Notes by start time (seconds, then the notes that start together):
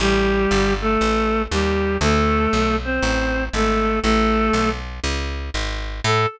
0.00 A1 G3 G4
0.51 G1
0.81 A3 A4
1.01 A1
1.51 D#2 G3 G4
2.01 D2 A3 A4
2.53 B1
2.84 C4 C5
3.03 A1
3.53 G#1 A3 A4
4.03 A1 A3 A4
4.53 B1
5.04 C#2
5.54 G#1
6.04 A2 A4